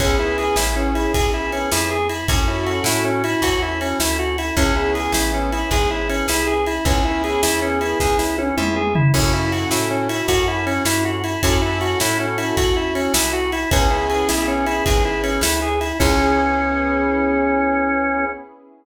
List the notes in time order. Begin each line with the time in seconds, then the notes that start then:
0.00 C#2 B3 C#4 E4 G#4, kick, ride
0.19 E4
0.38 G#4, ride
0.56 A1 E4, snare
0.76 C#4
0.95 E4, ride
1.14 B1 G#4, kick, ride
1.34 E4
1.52 C#4, ride
1.72 F2 E4, snare
1.91 G#4
2.09 E4, ride
2.28 F#2 C#4 E4 F#4 A4, kick, ride
2.47 E4
2.67 F#4, ride
2.84 A2 E4, snare
3.04 C#4
3.24 E4, ride
3.42 E2 F#4, kick, ride
3.62 E4
3.81 C#4, ride
4.00 D2 E4, snare
4.19 F#4
4.38 E4, ride
4.57 C#2 B3 C#4 E4 G#4, kick, ride
4.76 E4
4.95 G#4, ride
5.12 A1 E4, snare
5.34 C#4
5.52 E4, ride
5.71 G#1 G#4, kick, ride
5.90 E4
6.09 C#4, ride
6.28 C2 E4, snare
6.47 G#4
6.67 E4, ride
6.85 C#2 B3 C#4 E4 G#4, kick, ride
7.05 E4
7.24 G#4, ride
7.43 E2 E4, snare
7.62 C#4
7.81 E4, ride
8.00 C#2 G#4, kick, snare
8.19 E4, snare
8.38 C#4, high tom
8.57 F2 E4, mid tom
8.76 G#4, mid tom
8.95 E4, floor tom
9.14 F#2 C#4 E4 F#4 A4, kick, crash
9.33 E4
9.52 F#4, ride
9.71 A2 E4, snare
9.90 C#4
10.09 E4, ride
10.28 F#2 F#4, kick, ride
10.48 E4
10.66 C#4, ride
10.85 G2 E4, snare
11.05 F#4
11.24 E4, ride
11.43 F#2 C#4 E4 F#4 A4, kick, ride
11.62 E4
11.81 F#4, ride
12.00 A2 E4, snare
12.20 C#4
12.38 E4, ride
12.57 E2 F#4, kick, ride
12.76 E4
12.95 C#4, ride
13.14 C2 E4, snare
13.33 F#4
13.52 E4, ride
13.71 C#2 B3 C#4 E4 G#4, kick, ride
13.91 E4
14.10 G#4, ride
14.29 B1 E4, snare
14.48 C#4
14.66 E4, ride
14.86 G#1 G#4, kick, ride
15.05 E4
15.23 C#4, ride
15.41 D2 E4, snare
15.62 G#4
15.81 E4, ride
16.00 C#2 B3 C#4 E4 G#4, kick, crash